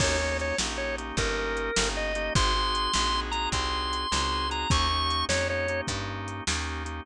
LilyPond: <<
  \new Staff \with { instrumentName = "Drawbar Organ" } { \time 12/8 \key ees \major \tempo 4. = 102 des''4 des''8 r8 des''8 r8 bes'2 ees''4 | c'''2~ c'''8 bes''8 c'''2~ c'''8 bes''8 | des'''4. des''8 des''4 r2. | }
  \new Staff \with { instrumentName = "Drawbar Organ" } { \time 12/8 \key ees \major <bes des' ees' g'>8 <bes des' ees' g'>4 <bes des' ees' g'>8 <bes des' ees' g'>8 <bes des' ees' g'>8 <bes des' ees' g'>4. <bes des' ees' g'>4 <bes des' ees' g'>8 | <c' ees' ges' aes'>8 <c' ees' ges' aes'>4 <c' ees' ges' aes'>8 <c' ees' ges' aes'>8 <c' ees' ges' aes'>8 <c' ees' ges' aes'>4. <c' ees' ges' aes'>4 <c' ees' ges' aes'>8 | <bes des' ees' g'>8 <bes des' ees' g'>4 <bes des' ees' g'>8 <bes des' ees' g'>8 <bes des' ees' g'>8 <bes des' ees' g'>4. <bes des' ees' g'>4 <bes des' ees' g'>8 | }
  \new Staff \with { instrumentName = "Electric Bass (finger)" } { \clef bass \time 12/8 \key ees \major ees,4. bes,,4. g,,4. g,,4. | aes,,4. bes,,4. c,4. des,4. | ees,4. f,4. g,4. ees,4. | }
  \new DrumStaff \with { instrumentName = "Drums" } \drummode { \time 12/8 <cymc bd>4 hh8 sn4 hh8 <hh bd>4 hh8 sn4 hh8 | <hh bd>4 hh8 sn4 hh8 <hh bd>4 hh8 sn4 hh8 | <hh bd>4 hh8 sn4 hh8 <hh bd>4 hh8 sn4 hh8 | }
>>